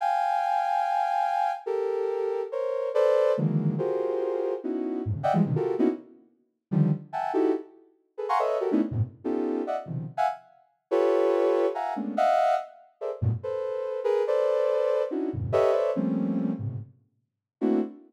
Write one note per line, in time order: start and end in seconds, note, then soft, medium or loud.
0.01 1.52 F5 medium
0.01 1.52 G5 medium
0.01 1.52 G#5 medium
1.66 2.42 G4 medium
1.66 2.42 A4 medium
1.66 2.42 A#4 medium
2.52 2.89 A#4 medium
2.52 2.89 C5 medium
2.52 2.89 C#5 medium
2.94 3.32 A4 loud
2.94 3.32 B4 loud
2.94 3.32 C5 loud
2.94 3.32 D5 loud
3.37 3.75 D3 medium
3.37 3.75 D#3 medium
3.37 3.75 E3 medium
3.37 3.75 F#3 medium
3.37 3.75 G#3 medium
3.37 3.75 A#3 medium
3.78 4.54 F4 medium
3.78 4.54 F#4 medium
3.78 4.54 G4 medium
3.78 4.54 G#4 medium
3.78 4.54 A#4 medium
3.78 4.54 C5 medium
4.63 5.01 B3 medium
4.63 5.01 C#4 medium
4.63 5.01 D#4 medium
4.63 5.01 E4 medium
4.63 5.01 F#4 medium
5.05 5.15 F2 medium
5.05 5.15 G2 medium
5.05 5.15 G#2 medium
5.05 5.15 A2 medium
5.15 5.24 C3 medium
5.15 5.24 C#3 medium
5.15 5.24 D3 medium
5.23 5.33 D5 medium
5.23 5.33 D#5 medium
5.23 5.33 E5 medium
5.23 5.33 F#5 medium
5.23 5.33 G5 medium
5.33 5.43 E3 loud
5.33 5.43 F3 loud
5.33 5.43 G3 loud
5.33 5.43 G#3 loud
5.45 5.54 B2 medium
5.45 5.54 C3 medium
5.45 5.54 D3 medium
5.45 5.54 D#3 medium
5.56 5.74 F4 medium
5.56 5.74 F#4 medium
5.56 5.74 G4 medium
5.56 5.74 A4 medium
5.56 5.74 A#4 medium
5.78 5.88 A#3 loud
5.78 5.88 B3 loud
5.78 5.88 C#4 loud
5.78 5.88 D#4 loud
5.78 5.88 E4 loud
5.78 5.88 F#4 loud
6.71 6.90 D3 loud
6.71 6.90 D#3 loud
6.71 6.90 F3 loud
6.71 6.90 G3 loud
7.13 7.31 E5 medium
7.13 7.31 F#5 medium
7.13 7.31 G5 medium
7.13 7.31 G#5 medium
7.13 7.31 A5 medium
7.33 7.52 D#4 medium
7.33 7.52 E4 medium
7.33 7.52 F#4 medium
7.33 7.52 G4 medium
7.33 7.52 A4 medium
8.17 8.27 G#4 medium
8.17 8.27 A4 medium
8.17 8.27 B4 medium
8.29 8.38 F5 medium
8.29 8.38 F#5 medium
8.29 8.38 G#5 medium
8.29 8.38 A#5 medium
8.29 8.38 C6 medium
8.29 8.38 C#6 medium
8.39 8.58 A4 medium
8.39 8.58 B4 medium
8.39 8.58 C#5 medium
8.39 8.58 D#5 medium
8.39 8.58 E5 medium
8.60 8.70 F#4 medium
8.60 8.70 G4 medium
8.60 8.70 A4 medium
8.60 8.70 A#4 medium
8.71 8.81 A3 loud
8.71 8.81 B3 loud
8.71 8.81 C#4 loud
8.71 8.81 D4 loud
8.71 8.81 D#4 loud
8.71 8.81 E4 loud
8.91 9.01 F#2 medium
8.91 9.01 G#2 medium
8.91 9.01 A2 medium
8.91 9.01 A#2 medium
8.91 9.01 B2 medium
8.91 9.01 C3 medium
9.24 9.62 B3 medium
9.24 9.62 C#4 medium
9.24 9.62 D#4 medium
9.24 9.62 F4 medium
9.24 9.62 G4 medium
9.24 9.62 A4 medium
9.67 9.76 D5 medium
9.67 9.76 D#5 medium
9.67 9.76 E5 medium
9.67 9.76 F#5 medium
9.86 10.05 B2 medium
9.86 10.05 C3 medium
9.86 10.05 C#3 medium
9.86 10.05 D#3 medium
9.86 10.05 F3 medium
10.17 10.27 E5 medium
10.17 10.27 F5 medium
10.17 10.27 F#5 medium
10.17 10.27 G#5 medium
10.91 11.66 F4 loud
10.91 11.66 G4 loud
10.91 11.66 A4 loud
10.91 11.66 B4 loud
10.91 11.66 C#5 loud
11.74 11.93 E5 medium
11.74 11.93 F5 medium
11.74 11.93 F#5 medium
11.74 11.93 G#5 medium
11.74 11.93 A#5 medium
11.96 12.14 G#3 medium
11.96 12.14 A3 medium
11.96 12.14 A#3 medium
11.96 12.14 B3 medium
11.96 12.14 C#4 medium
11.96 12.14 D4 medium
12.17 12.55 D#5 loud
12.17 12.55 E5 loud
12.17 12.55 F5 loud
12.17 12.55 F#5 loud
13.01 13.10 G#4 medium
13.01 13.10 A4 medium
13.01 13.10 A#4 medium
13.01 13.10 C5 medium
13.01 13.10 D5 medium
13.01 13.10 E5 medium
13.21 13.31 F#2 loud
13.21 13.31 G2 loud
13.21 13.31 A2 loud
13.21 13.31 A#2 loud
13.21 13.31 B2 loud
13.43 14.00 A4 medium
13.43 14.00 B4 medium
13.43 14.00 C5 medium
14.04 14.23 G#4 loud
14.04 14.23 A#4 loud
14.04 14.23 B4 loud
14.27 15.03 A4 medium
14.27 15.03 B4 medium
14.27 15.03 C5 medium
14.27 15.03 D5 medium
15.10 15.29 C#4 medium
15.10 15.29 D4 medium
15.10 15.29 D#4 medium
15.10 15.29 E4 medium
15.10 15.29 F#4 medium
15.33 15.52 E2 medium
15.33 15.52 F2 medium
15.33 15.52 G2 medium
15.33 15.52 A2 medium
15.33 15.52 B2 medium
15.33 15.52 C#3 medium
15.52 15.71 G4 loud
15.52 15.71 A4 loud
15.52 15.71 B4 loud
15.52 15.71 C#5 loud
15.52 15.71 D#5 loud
15.52 15.71 E5 loud
15.72 15.91 A4 medium
15.72 15.91 B4 medium
15.72 15.91 C5 medium
15.72 15.91 C#5 medium
15.72 15.91 D5 medium
15.72 15.91 E5 medium
15.95 16.52 F3 medium
15.95 16.52 G3 medium
15.95 16.52 A3 medium
15.95 16.52 A#3 medium
15.95 16.52 C4 medium
15.95 16.52 C#4 medium
16.59 16.77 G#2 medium
16.59 16.77 A2 medium
16.59 16.77 B2 medium
16.59 16.77 C3 medium
16.59 16.77 C#3 medium
17.61 17.80 A3 medium
17.61 17.80 A#3 medium
17.61 17.80 C4 medium
17.61 17.80 D4 medium
17.61 17.80 E4 medium
17.61 17.80 F#4 medium